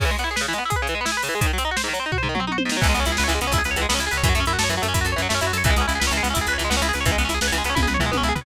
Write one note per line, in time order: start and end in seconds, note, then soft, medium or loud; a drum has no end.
0.00 0.05 C#3 medium
0.00 kick loud
0.00 crash loud
0.05 0.10 E3 medium
0.11 0.16 G#3 medium
0.19 0.24 B3 medium
0.19 closed hi-hat medium
0.24 0.29 E4 medium
0.31 0.36 G#4 medium
0.36 0.41 B4 medium
0.36 snare loud
0.41 0.46 C#3 medium
0.48 0.54 E3 medium
0.53 0.59 G#3 medium
0.53 closed hi-hat medium
0.58 0.64 B3 medium
0.65 0.71 E4 medium
0.70 0.75 G#4 medium
0.70 kick medium
0.70 closed hi-hat medium
0.76 0.81 B4 medium
0.82 0.87 C#3 medium
0.87 0.94 E3 medium
0.87 closed hi-hat medium
0.95 1.00 G#3 medium
1.01 1.06 B3 medium
1.05 1.11 E4 medium
1.05 snare loud
1.12 1.17 G#4 medium
1.17 1.22 B4 medium
1.23 1.29 C#3 medium
1.23 open hi-hat medium
1.29 1.34 E3 medium
1.35 1.40 G#3 medium
1.41 1.46 G#2 medium
1.41 kick loud
1.41 closed hi-hat loud
1.46 1.52 D#3 medium
1.53 1.59 F#3 medium
1.58 1.63 C4 medium
1.58 closed hi-hat medium
1.65 1.70 D#4 medium
1.71 1.77 F#4 medium
1.77 1.82 C5 medium
1.77 snare loud
1.84 1.89 G#2 medium
1.88 1.93 D#3 medium
1.93 1.99 F#3 medium
1.93 closed hi-hat medium
2.00 2.05 C4 medium
2.06 2.11 D#4 medium
2.12 2.17 F#4 medium
2.12 kick medium
2.12 floor tom medium
2.18 2.23 C5 medium
2.23 2.28 G#2 medium
2.23 floor tom medium
2.29 2.34 D#3 medium
2.35 2.40 F#3 medium
2.35 mid tom medium
2.40 2.45 C4 medium
2.47 2.53 D#4 medium
2.47 high tom medium
2.52 2.57 F#4 medium
2.58 2.63 C5 medium
2.58 high tom loud
2.65 2.71 G#2 medium
2.69 2.77 D#3 soft
2.69 snare loud
2.77 2.82 F#3 medium
2.81 2.94 C#2 loud
2.81 2.87 E3 medium
2.81 kick loud
2.81 crash loud
2.89 2.94 G#3 medium
2.94 3.05 C#2 medium
2.94 3.00 B3 medium
2.94 closed hi-hat medium
3.00 3.05 C#4 medium
3.05 3.17 C#2 medium
3.05 3.11 E4 medium
3.05 closed hi-hat medium
3.12 3.17 G#4 medium
3.17 3.29 C#2 medium
3.17 3.23 B4 medium
3.17 snare loud
3.24 3.29 C#5 medium
3.28 3.39 C#2 loud
3.28 3.33 E3 medium
3.28 closed hi-hat medium
3.35 3.40 G#3 medium
3.41 3.51 C#2 medium
3.41 3.47 B3 medium
3.41 closed hi-hat medium
3.47 3.52 C#4 medium
3.52 3.62 C#2 medium
3.52 3.59 E4 medium
3.52 kick medium
3.52 closed hi-hat loud
3.58 3.63 G#4 medium
3.64 3.75 C#2 medium
3.64 3.70 B4 medium
3.64 closed hi-hat medium
3.71 3.76 C#5 medium
3.76 3.86 C#2 medium
3.76 3.83 E3 medium
3.76 closed hi-hat medium
3.81 3.87 G#3 medium
3.89 3.98 C#2 medium
3.89 3.94 B3 medium
3.89 snare loud
3.94 4.00 C#4 medium
3.99 4.09 C#2 medium
3.99 4.05 E4 medium
3.99 closed hi-hat medium
4.07 4.12 G#4 medium
4.11 4.23 C#2 medium
4.11 4.17 B4 medium
4.11 closed hi-hat medium
4.17 4.23 C#5 medium
4.23 4.33 F#2 loud
4.23 4.29 E3 medium
4.23 kick loud
4.23 closed hi-hat loud
4.29 4.34 F#3 medium
4.35 4.45 F#2 medium
4.35 4.41 A3 medium
4.35 closed hi-hat medium
4.40 4.45 C#4 medium
4.46 4.57 F#2 medium
4.46 4.52 E4 medium
4.46 closed hi-hat medium
4.53 4.58 F#4 medium
4.59 4.69 F#2 medium
4.59 4.64 A4 medium
4.59 snare loud
4.64 4.69 C#5 medium
4.69 4.79 F#2 medium
4.69 4.75 E3 medium
4.69 closed hi-hat medium
4.77 4.83 F#3 medium
4.82 4.93 F#2 medium
4.82 4.87 A3 medium
4.82 closed hi-hat medium
4.88 4.94 C#4 medium
4.94 5.04 F#2 medium
4.94 4.99 E4 medium
4.94 kick medium
4.94 closed hi-hat loud
5.01 5.15 F#2 medium
5.01 5.06 F#4 medium
5.06 5.11 A4 medium
5.06 closed hi-hat medium
5.12 5.17 C#5 medium
5.16 5.28 F#2 medium
5.16 5.22 E3 medium
5.16 closed hi-hat medium
5.22 5.27 F#3 medium
5.29 5.41 F#2 medium
5.29 5.34 A3 medium
5.29 snare loud
5.35 5.40 C#4 medium
5.41 5.52 F#2 medium
5.41 5.47 E4 medium
5.41 closed hi-hat medium
5.47 5.52 F#4 medium
5.53 5.63 F#2 medium
5.53 5.58 A4 medium
5.53 closed hi-hat medium
5.58 5.63 C#5 medium
5.64 5.74 C#2 loud
5.64 5.71 E3 medium
5.64 kick loud
5.64 closed hi-hat loud
5.70 5.76 G#3 medium
5.76 5.86 C#2 medium
5.76 5.83 B3 medium
5.76 closed hi-hat medium
5.81 5.86 C#4 medium
5.88 5.99 C#2 medium
5.88 5.93 E4 medium
5.88 closed hi-hat medium
5.95 6.01 G#4 medium
6.00 6.10 C#2 medium
6.00 6.05 B4 medium
6.00 snare loud
6.07 6.21 C#2 medium
6.07 6.12 C#5 medium
6.12 6.18 E3 medium
6.12 closed hi-hat medium
6.17 6.22 G#3 medium
6.23 6.34 C#2 medium
6.23 6.28 B3 medium
6.23 closed hi-hat medium
6.30 6.36 C#4 medium
6.30 6.39 E4 medium
6.35 6.46 C#2 medium
6.35 kick medium
6.35 closed hi-hat loud
6.41 6.47 G#4 medium
6.47 6.57 C#2 medium
6.47 6.54 B4 medium
6.47 closed hi-hat medium
6.53 6.58 C#5 medium
6.58 6.69 C#2 medium
6.58 6.63 E3 medium
6.58 closed hi-hat medium
6.65 6.70 G#3 medium
6.70 6.81 C#2 medium
6.70 6.75 B3 medium
6.70 snare loud
6.77 6.82 C#4 medium
6.82 6.92 C#2 medium
6.82 6.87 E4 medium
6.82 closed hi-hat medium
6.89 6.94 G#4 medium
6.93 7.05 C#2 medium
6.93 6.99 B4 medium
6.93 closed hi-hat medium
7.01 7.06 C#5 medium
7.06 7.16 C#2 loud
7.06 7.11 E3 medium
7.06 kick loud
7.06 closed hi-hat medium
7.12 7.17 G#3 medium
7.18 7.28 C#2 medium
7.18 7.23 B3 medium
7.18 closed hi-hat medium
7.25 7.30 C#4 medium
7.25 7.34 E4 medium
7.29 7.39 C#2 medium
7.29 closed hi-hat medium
7.34 7.40 G#4 medium
7.41 7.51 C#2 medium
7.41 7.47 B4 medium
7.41 snare loud
7.48 7.53 C#5 medium
7.52 7.62 C#2 medium
7.52 7.58 E3 medium
7.52 closed hi-hat medium
7.58 7.63 G#3 medium
7.64 7.74 C#2 medium
7.64 7.71 B3 medium
7.64 closed hi-hat medium
7.70 7.75 C#4 medium
7.75 7.86 C#2 loud
7.75 7.80 E4 medium
7.75 kick medium
7.75 high tom medium
7.83 7.88 G#4 medium
7.87 7.97 C#2 medium
7.87 7.93 B4 medium
7.87 mid tom medium
7.94 8.00 C#5 medium
7.99 8.11 C#2 medium
7.99 8.05 E3 medium
7.99 floor tom medium
8.06 8.11 G#3 medium
8.12 8.23 C#2 medium
8.12 8.17 B3 medium
8.12 high tom medium
8.17 8.23 C#4 medium
8.23 8.33 C#2 medium
8.23 8.29 E4 medium
8.29 8.34 G#4 medium
8.35 8.45 C#2 medium
8.35 8.41 B4 medium
8.35 floor tom loud
8.41 8.45 C#5 medium